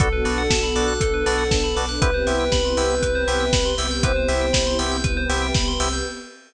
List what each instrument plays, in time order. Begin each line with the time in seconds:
0.00 synth bass 2 B1, drawbar organ B3 D4 F#4 A4, pad 2 (warm) B3 D4 F#4 A4, ocarina A4, tubular bells A4, kick, closed hi-hat
0.13 tubular bells B4
0.25 synth bass 2 B1, drawbar organ B3 D4 F#4 A4, tubular bells D5, open hi-hat
0.38 tubular bells F#5
0.50 synth bass 2 B1, tubular bells A5, kick, snare
0.63 tubular bells B5
0.76 synth bass 2 B1, drawbar organ B3 D4 F#4 A4, tubular bells D6, open hi-hat
0.88 tubular bells F#6
1.01 synth bass 2 B1, pad 2 (warm) B3 D4 A4 B4, tubular bells A4, kick, closed hi-hat
1.14 tubular bells B4
1.26 synth bass 2 B1, drawbar organ B3 D4 F#4 A4, tubular bells D5, open hi-hat
1.38 tubular bells F#5
1.51 synth bass 2 B1, tubular bells A5, kick, snare
1.64 tubular bells B5
1.76 synth bass 2 B1, drawbar organ B3 D4 F#4 A4, tubular bells D6, open hi-hat
1.89 tubular bells F#6
2.01 synth bass 2 C2, pad 2 (warm) B3 C4 E4 G4, drawbar organ B3 C4 E4 G4, tubular bells B4, ocarina B4, kick, closed hi-hat
2.14 tubular bells C5
2.27 synth bass 2 C2, drawbar organ B3 C4 E4 G4, tubular bells E5, open hi-hat
2.40 tubular bells G5
2.52 synth bass 2 C2, tubular bells B5, kick, snare
2.65 tubular bells C6
2.77 synth bass 2 C2, drawbar organ B3 C4 E4 G4, tubular bells E6, open hi-hat
2.90 tubular bells G6
3.02 synth bass 2 C2, pad 2 (warm) B3 C4 G4 B4, tubular bells B4, kick, closed hi-hat
3.15 tubular bells C5
3.28 synth bass 2 C2, drawbar organ B3 C4 E4 G4, tubular bells E5, open hi-hat
3.40 tubular bells G5
3.53 synth bass 2 C2, tubular bells B5, kick, snare
3.65 tubular bells C6
3.78 synth bass 2 C2, drawbar organ B3 C4 E4 G4, tubular bells E6, open hi-hat
3.91 tubular bells G6
4.03 synth bass 2 C2, pad 2 (warm) B3 C4 E4 G4, drawbar organ B3 C4 E4 G4, tubular bells B4, ocarina C5, kick, closed hi-hat
4.16 tubular bells C5
4.28 synth bass 2 C2, drawbar organ B3 C4 E4 G4, tubular bells E5, open hi-hat
4.41 tubular bells G5
4.53 synth bass 2 C2, tubular bells B5, kick, snare
4.67 tubular bells C6
4.79 synth bass 2 C2, drawbar organ B3 C4 E4 G4, tubular bells E6, open hi-hat
4.92 tubular bells G6
5.04 synth bass 2 C2, pad 2 (warm) B3 C4 G4 B4, tubular bells B4, kick, closed hi-hat
5.17 tubular bells C5
5.29 synth bass 2 C2, drawbar organ B3 C4 E4 G4, tubular bells E5, open hi-hat
5.42 tubular bells G5
5.54 synth bass 2 C2, tubular bells B5, kick, snare
5.68 tubular bells C6
5.80 synth bass 2 C2, drawbar organ B3 C4 E4 G4, tubular bells E6, open hi-hat
5.93 tubular bells G6